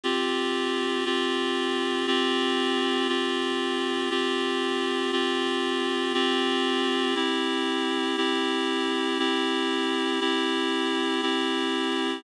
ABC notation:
X:1
M:6/8
L:1/8
Q:3/8=118
K:C
V:1 name="Clarinet"
[CFG]6 | [CFG]6 | [CFG]6 | [CFG]6 |
[CFG]6 | [CFG]6 | [CFG]6 | [CEG]6 |
[CEG]6 | [CEG]6 | [CEG]6 | [CEG]6 |]